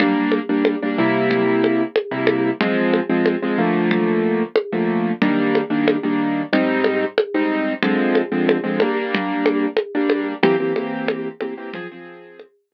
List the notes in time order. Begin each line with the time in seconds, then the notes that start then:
0.00 G3 A#3 D4, low conga
0.32 high conga
0.49 G3 A#3 D4
0.65 high conga
0.82 G3 A#3 D4
0.98 C3 G3 A#3 E4
1.31 low conga
1.64 high conga
1.96 high conga
2.11 C3 G3 A#3 E4
2.27 high conga
2.61 F3 G#3 C4, low conga
2.93 high conga
3.10 F3 G#3 C4
3.26 high conga
3.42 F3 G#3 C4
3.58 D3 F3 A3 A#3
3.91 low conga
4.56 high conga
4.72 D3 F3 A3 A#3
5.22 D#3 G3 A#3 D4, low conga
5.55 high conga
5.70 D#3 G3 A#3 D4
5.88 high conga
6.03 D#3 G3 A#3 D4
6.53 G#2 G3 C4 D#4, low conga
6.84 high conga
7.18 high conga
7.34 G#2 G3 C4 D#4
7.82 D3 F3 G#3 C4, low conga
8.15 high conga
8.32 D3 F3 G#3 C4
8.49 high conga
8.64 D3 F3 G#3 C4
8.80 G3 A#3 D4, high conga
9.15 low conga
9.46 high conga
9.77 high conga
9.95 G3 A#3 D4
10.10 high conga
10.43 E3 A#3 C4 G4, low conga
10.60 E3 A#3 C4 G4
10.76 E3 A#3 C4 G4, high conga
11.08 high conga
11.41 E3 A#3 C4 G4, high conga
11.57 E3 A#3 C4 G4
11.74 F3 C4 G#4, low conga
11.92 F3 C4 G#4
12.40 high conga
12.72 F3 C4 G#4